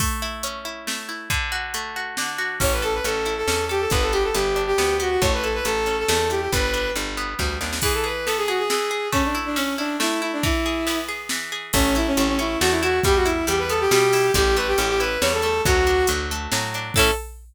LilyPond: <<
  \new Staff \with { instrumentName = "Violin" } { \time 3/4 \key a \mixolydian \tempo 4 = 138 r2. | r2. | cis''16 b'16 a'16 b'16 a'8. a'8. g'16 a'16 | b'16 a'16 g'16 a'16 g'8. g'8. fis'16 fis'16 |
cis''16 b'16 a'16 b'16 a'8. a'8. g'16 g'16 | b'4 r2 | \key e \mixolydian gis'16 a'16 b'8 a'16 gis'16 fis'16 gis'16 gis'4 | cis'16 d'16 r16 d'16 cis'8 d'8 e'8 e'16 d'16 |
e'4. r4. | \key a \mixolydian cis'8 e'16 cis'16 cis'16 cis'16 e'8 fis'16 e'16 fis'8 | g'16 fis'16 e'8 g'16 b'16 a'16 g'16 g'4 | g'8 b'16 g'16 g'16 g'16 b'8 cis''16 a'16 a'8 |
fis'4 r2 | a'4 r2 | }
  \new Staff \with { instrumentName = "Pizzicato Strings" } { \time 3/4 \key a \mixolydian a8 e'8 cis'8 e'8 a8 e'8 | d8 fis'8 a8 fis'8 d8 fis'8 | cis'8 a'8 cis'8 e'8 cis'8 a'8 | b8 g'8 b8 d'8 b8 g'8 |
a8 e'8 a8 cis'8 a8 e'8 | g8 d'8 g8 b8 g8 d'8 | \key e \mixolydian e8 gis'8 b8 gis'8 e8 gis'8 | a8 e'8 cis'8 e'8 a8 e'8 |
e8 gis'8 b8 gis'8 e8 gis'8 | \key a \mixolydian a8 e'8 a8 cis'8 a8 e'8 | g8 e'8 g8 b8 g8 e'8 | g8 a8 cis'8 e'8 g8 a8 |
fis8 d'8 fis8 a8 fis8 d'8 | <cis' e' a'>4 r2 | }
  \new Staff \with { instrumentName = "Electric Bass (finger)" } { \clef bass \time 3/4 \key a \mixolydian r2. | r2. | a,,4 a,,4 e,4 | g,,4 g,,4 d,4 |
a,,4 a,,4 e,4 | g,,4 g,,4 d,8 dis,8 | \key e \mixolydian r2. | r2. |
r2. | \key a \mixolydian a,,4 a,,4 e,4 | e,4 e,4 b,4 | a,,4 a,,4 e,4 |
d,4 d,4 a,4 | a,4 r2 | }
  \new DrumStaff \with { instrumentName = "Drums" } \drummode { \time 3/4 <cymc bd>4 hh4 sn4 | <hh bd>4 hh4 sn4 | <cymc bd>8 hh8 hh8 hh8 sn8 hh8 | <hh bd>8 hh8 hh8 hh8 sn8 hh8 |
<hh bd>8 hh8 hh8 hh8 sn8 hh8 | <hh bd>8 hh8 hh8 hh8 <bd sn>8 sn16 sn16 | <cymc bd>4 cymr4 sn4 | <bd cymr>4 cymr4 sn4 |
<bd cymr>4 cymr4 sn4 | <cymc bd>8 hh8 hh8 hh8 sn8 hh8 | <hh bd>8 hh8 hh8 hh8 sn8 hho8 | <hh bd>8 hh8 hh8 hh8 sn8 hh8 |
<hh bd>8 hh8 hh8 hh8 sn8 hh8 | <cymc bd>4 r4 r4 | }
>>